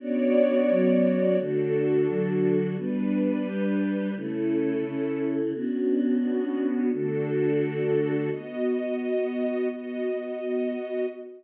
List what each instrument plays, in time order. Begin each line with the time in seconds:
0.00 choir aahs B3 C#4 D4 F#4, string ensemble 1 B3 F#4 C#5 D5
0.69 choir aahs F#3 B3 C#4 F#4
1.38 choir aahs D3 A3 F#4, string ensemble 1 D4 F#4 A4
2.08 choir aahs D3 F#3 F#4
2.77 choir aahs G3 B3 D4, string ensemble 1 G3 D4 B4
3.46 choir aahs G3 D4 G4
4.15 choir aahs C#3 A3 E4, string ensemble 1 C#4 E4 A4
4.85 choir aahs C#3 C#4 E4
5.54 string ensemble 1 B3 C#4 D4 F#4, choir aahs B3 C#4 D4 F#4
6.92 choir aahs D3 A3 F#4, string ensemble 1 D4 F#4 A4
8.31 string ensemble 1 B3 F#4 D#5
9.69 string ensemble 1 B3 F#4 D#5